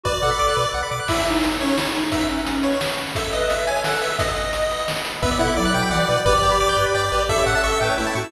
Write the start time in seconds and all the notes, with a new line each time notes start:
0.04 B1 F#4 B4 D5, kick
0.14 D5
0.21 B2 A4 F#5
0.31 B5
0.39 B1 D6
0.48 F#6
0.57 B2 B4
0.65 D5
0.74 B1 F#5
0.83 B5
0.91 B2 D6
1.00 F#6
1.08 E4 C#5 E5 G#5, kick, crash
1.17 closed hi-hat
1.26 D#4, closed hi-hat
1.34 closed hi-hat
1.43 closed hi-hat
1.51 closed hi-hat
1.60 C#4 G#4 C#5 G#5, closed hi-hat
1.69 closed hi-hat
1.76 E4, snare
1.86 closed hi-hat
1.95 D#4, closed hi-hat
2.03 closed hi-hat
2.12 D#4 B4 D#5 E5 F#5, kick, closed hi-hat
2.21 closed hi-hat
2.29 C#4, closed hi-hat
2.38 closed hi-hat
2.46 closed hi-hat
2.55 closed hi-hat
2.63 B4 C#5 F#5 B5, closed hi-hat
2.72 closed hi-hat
2.81 snare
2.89 closed hi-hat
2.98 closed hi-hat
3.07 open hi-hat
3.15 A4 C#5 E5, kick, closed hi-hat
3.24 closed hi-hat
3.33 B4 D#5, closed hi-hat
3.41 closed hi-hat
3.50 E5, closed hi-hat
3.58 closed hi-hat
3.67 A4 C#5 E5 G#5 A5, closed hi-hat
3.76 closed hi-hat
3.84 A4 F#5, snare
3.93 closed hi-hat
4.01 B4 E5, closed hi-hat
4.10 closed hi-hat
4.18 B4 D#5 F#5, kick, closed hi-hat
4.28 closed hi-hat
4.36 closed hi-hat
4.45 closed hi-hat
4.53 closed hi-hat
4.62 closed hi-hat
4.71 B4 F#5 B5, closed hi-hat
4.79 closed hi-hat
4.88 snare
4.96 closed hi-hat
5.05 closed hi-hat
5.14 closed hi-hat
5.22 B1 B3 B4 D5 E5 F#5, kick
5.31 D5
5.39 B2 E4 A4 F#5
5.48 B5
5.57 B1 F#3 D5 D6
5.65 F#6
5.74 B2 F#4 B4 F#5 G5 D6
5.83 B5
5.90 B1 E3 D5 F#5
6.00 D5
6.09 B2 B4
6.17 D5
6.25 G1 G4 B4 D5 G5, kick
6.34 D5
6.42 G2 G5
6.52 B5
6.60 G1 D6
6.69 G6
6.76 G2 G4 B4 G5 D6
6.86 B5
6.94 G2 D5 G5
7.03 D5
7.12 A1 G4 B4
7.20 D5
7.29 C#4 E4 A4 E5, kick
7.38 C#5
7.46 A2 E5 F#5
7.55 A4 A5
7.63 A1 E5 C#6
7.72 E6
7.81 A2 A3 C#4 A4 B4 G5
7.90 C#5
7.98 A1 A3 E4 E5
8.07 A5
8.15 A2 F#4 C#6
8.24 E6